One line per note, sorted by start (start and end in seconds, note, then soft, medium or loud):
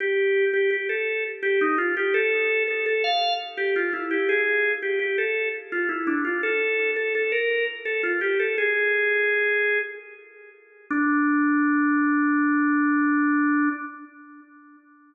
0.00 0.45 G4 medium
0.53 0.70 G4 medium
0.71 0.88 G4 medium
0.89 1.24 A4 medium
1.43 1.60 G4 medium
1.61 1.78 D#4 medium
1.78 1.95 F4 medium
1.97 2.14 G4 medium
2.14 2.63 A4 medium
2.68 2.85 A4 medium
2.86 3.03 A4 medium
3.04 3.34 F5 medium
3.57 3.74 G4 medium
3.76 3.93 F4 medium
3.93 4.10 E4 medium
4.11 4.28 G4 medium
4.29 4.72 G#4 medium
4.82 4.99 G4 medium
4.99 5.16 G4 medium
5.18 5.49 A4 medium
5.72 5.89 F4 medium
5.89 6.06 E4 medium
6.07 6.24 D4 medium
6.25 6.42 F4 medium
6.43 6.91 A4 medium
6.96 7.13 A4 medium
7.15 7.32 A4 medium
7.32 7.65 A#4 medium
7.85 8.02 A4 medium
8.03 8.20 F4 medium
8.21 8.38 G4 medium
8.39 8.56 A4 medium
8.58 9.79 G#4 medium
10.91 13.69 D4 loud